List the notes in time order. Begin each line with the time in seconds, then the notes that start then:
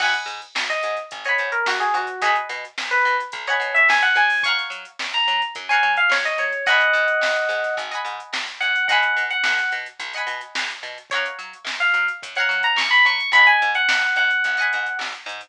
0.00 G#1 D#5 F#5 G#5 B5, kick, crash
0.14 closed hi-hat
0.26 G#2, closed hi-hat
0.42 closed hi-hat
0.55 G#1, snare
0.70 D#5, closed hi-hat
0.83 G#2, closed hi-hat
0.97 closed hi-hat
1.11 G#1, kick, closed hi-hat
1.24 C#5 D#5 F#5 G#5, closed hi-hat
1.29 B5
1.38 G#2, closed hi-hat
1.52 A#4, closed hi-hat
1.66 G#1 F#4, snare
1.80 G#4, closed hi-hat
1.94 G#2 F#4, closed hi-hat
2.07 closed hi-hat
2.22 B1 G#4 D#5 F#5 G#5, kick, closed hi-hat
2.26 B5
2.36 closed hi-hat
2.49 B2, snare, closed hi-hat
2.65 closed hi-hat
2.78 B1, snare
2.91 B4, closed hi-hat
3.05 B2, snare, closed hi-hat
3.20 closed hi-hat
3.32 B1, kick, closed hi-hat
3.47 C#5 D#5 F#5 G#5 B5, snare, closed hi-hat
3.60 B2, closed hi-hat
3.75 E5, closed hi-hat
3.89 B1 G#5, snare
4.02 F#5, closed hi-hat
4.15 F#2 G#5, closed hi-hat
4.30 open hi-hat
4.43 C#5 F5 F#5 C#6, kick, closed hi-hat
4.48 A#5
4.58 snare, closed hi-hat
4.70 F#3, closed hi-hat
4.85 closed hi-hat
4.99 F#2, snare
5.13 A#5, closed hi-hat
5.28 F#3, closed hi-hat
5.42 closed hi-hat
5.55 F#2, kick, closed hi-hat
5.69 C#5 F5 F#5 G#5 A#5, closed hi-hat
5.83 F#3, closed hi-hat
5.97 F5, closed hi-hat
6.09 F#2 C#5, snare
6.25 D#5, snare, closed hi-hat
6.38 F#3 C#5, closed hi-hat
6.52 closed hi-hat
6.66 G#1 D#5 F#5 G#5 B5, kick, closed hi-hat
6.81 closed hi-hat
6.93 G#2, closed hi-hat
7.08 closed hi-hat
7.21 G#1, snare
7.36 closed hi-hat
7.49 G#2, snare, closed hi-hat
7.64 snare, closed hi-hat
7.77 G#1, kick, closed hi-hat
7.91 D#5 F#5 G#5 B5, closed hi-hat
8.05 G#2, closed hi-hat
8.20 closed hi-hat
8.33 G#1, snare
8.48 closed hi-hat
8.60 G#2 F#5, closed hi-hat
8.76 closed hi-hat
8.88 B1 D#5 F#5 G#5, kick, closed hi-hat
8.92 B5
9.03 closed hi-hat
9.17 B2, closed hi-hat
9.30 F#5, closed hi-hat
9.44 B1, snare
9.59 snare, closed hi-hat
9.72 B2, closed hi-hat
9.86 closed hi-hat
9.99 B1, kick, closed hi-hat
10.13 D#5 F#5 G#5, closed hi-hat
10.18 B5
10.27 B2, snare, closed hi-hat
10.41 closed hi-hat
10.55 B1, snare
10.70 closed hi-hat
10.83 B2, snare, closed hi-hat
10.98 closed hi-hat
11.10 F#2 C#5 F5, kick, closed hi-hat
11.14 F#5 A#5
11.26 closed hi-hat
11.39 F#3, closed hi-hat
11.53 closed hi-hat
11.64 F#2, snare
11.80 F5, closed hi-hat
11.94 F#3, closed hi-hat
12.08 closed hi-hat
12.23 F#2, kick, closed hi-hat
12.35 C#5 F5 F#5, closed hi-hat
12.40 A#5
12.49 F#3, snare, closed hi-hat
12.63 A#5, closed hi-hat
12.76 F#2 C#6, snare
12.91 B5, closed hi-hat
13.05 F#3 C#6, closed hi-hat
13.20 closed hi-hat
13.32 G#1 D#5 F#5 G#5 B5, kick, closed hi-hat
13.36 B5
13.47 G#5, closed hi-hat
13.62 G#2, closed hi-hat
13.75 F#5, closed hi-hat
13.89 G#1, snare
14.02 snare, closed hi-hat
14.16 G#2 F#5, closed hi-hat
14.30 closed hi-hat
14.44 G#1, kick, closed hi-hat
14.57 D#5 F#5 G#5, closed hi-hat
14.62 B5
14.73 G#2, closed hi-hat
14.86 closed hi-hat
14.99 G#1, snare
15.15 closed hi-hat
15.26 G#2, closed hi-hat
15.41 closed hi-hat